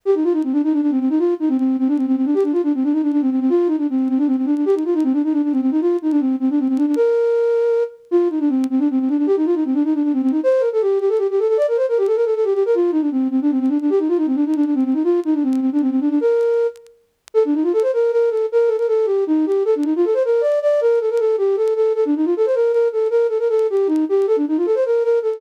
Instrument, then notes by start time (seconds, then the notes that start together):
flute
0.05 G4
0.15 D#4
0.24 F4
0.33 D#4
0.44 C4
0.52 D4
0.64 D#4
0.73 D4
0.82 D4
0.91 C4
1.00 C4
1.10 D#4
1.19 F4
1.40 D#4
1.49 C4
1.58 C4
1.79 C4
1.88 D4
1.97 C4
2.07 C4
2.16 C4
2.25 D4
2.34 G4
2.43 D4
2.52 F4
2.63 D4
2.74 C4
2.83 D4
2.92 D#4
3.02 D4
3.12 D4
3.21 C4
3.30 C4
3.40 C4
3.49 F4
3.67 D#4
3.78 D4
3.90 C4
4.09 C4
4.18 D4
4.27 C4
4.37 C4
4.46 D4
4.56 D4
4.66 G4
4.75 D#4
4.85 F4
4.94 D#4
5.04 C4
5.13 D4
5.24 D#4
5.33 D4
5.43 D4
5.52 C4
5.61 C4
5.71 D#4
5.81 F4
6.02 D#4
6.11 D4
6.20 C4
6.40 C4
6.50 D4
6.59 C4
6.68 C4
6.77 D4
6.86 D4
6.96 A#4
8.11 F4
8.30 D#4
8.40 D4
8.49 C4
8.70 C4
8.79 D4
8.91 C4
9.00 C4
9.09 D4
9.18 D4
9.27 G4
9.37 D#4
9.46 F4
9.55 D#4
9.65 C4
9.74 D4
9.84 D#4
9.94 D4
10.03 D4
10.13 C4
10.22 C4
10.31 D#4
10.43 C5
10.60 A#4
10.73 A4
10.81 G4
11.00 G4
11.09 A4
11.18 G4
11.30 G4
11.39 A4
11.48 A4
11.57 D5
11.68 A#4
11.77 C5
11.89 A#4
11.98 G4
12.07 A4
12.16 A#4
12.25 A4
12.35 A4
12.44 G4
12.54 G4
12.66 A#4
12.75 F4
12.92 D#4
13.01 D4
13.11 C4
13.31 C4
13.42 D4
13.51 C4
13.60 C4
13.69 D4
13.81 D4
13.90 G4
13.99 D#4
14.08 F4
14.17 D#4
14.26 C4
14.35 D4
14.46 D#4
14.56 D4
14.65 D4
14.75 C4
14.85 C4
14.94 D#4
15.04 F4
15.25 D#4
15.34 D4
15.43 C4
15.61 C4
15.72 D4
15.81 C4
15.90 C4
16.00 D4
16.10 D4
16.21 A#4
17.34 A4
17.45 D4
17.54 D#4
17.63 F4
17.73 A4
17.82 C5
17.93 A#4
18.12 A#4
18.30 A4
18.52 A#4
18.67 A4
18.78 A#4
18.88 A4
19.06 G4
19.27 D#4
19.46 G4
19.65 A4
19.75 D4
19.84 D#4
19.96 F4
20.05 A4
20.14 C5
20.25 A#4
20.41 D5
20.62 D5
20.81 A#4
21.00 A4
21.10 A#4
21.19 A4
21.38 G4
21.56 A4
21.76 A4
21.95 A4
22.05 D4
22.16 D#4
22.25 F4
22.37 A4
22.46 C5
22.55 A#4
22.72 A#4
22.92 A4
23.10 A#4
23.29 A4
23.39 A#4
23.49 A4
23.70 G4
23.87 D#4
24.09 G4
24.27 A4
24.36 D4
24.48 D#4
24.57 F4
24.66 A4
24.75 C5
24.85 A#4
25.04 A#4
25.22 A4